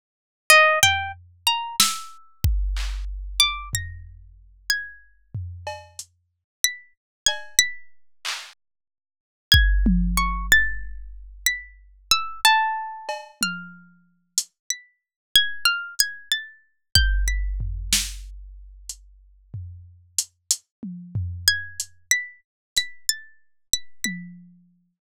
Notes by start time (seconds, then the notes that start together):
0.50 D#5, closed hi-hat
0.83 G5, floor tom
1.47 A#5
1.80 E6, snare
2.44 kick
2.76 clap
3.40 D6
3.73 A#6, floor tom
4.70 G#6
5.35 floor tom
5.67 cowbell
5.99 closed hi-hat
6.64 B6
7.26 G#6, cowbell
7.59 B6
8.25 clap
9.52 G#6, kick
9.86 high tom
10.17 C#6
10.52 A6
11.46 B6
12.11 E6
12.45 A5
13.09 cowbell
13.41 F6, high tom
14.38 closed hi-hat
14.70 B6
15.35 G#6
15.65 F6
15.99 G#6, closed hi-hat
16.32 A6
16.95 G6, kick
17.28 B6
17.60 floor tom
17.93 snare
18.89 closed hi-hat
19.54 floor tom
20.18 closed hi-hat
20.51 closed hi-hat
20.83 high tom
21.15 floor tom
21.48 G#6
21.80 closed hi-hat
22.11 B6
22.76 B6, closed hi-hat
23.09 A6
23.73 B6
24.04 B6, high tom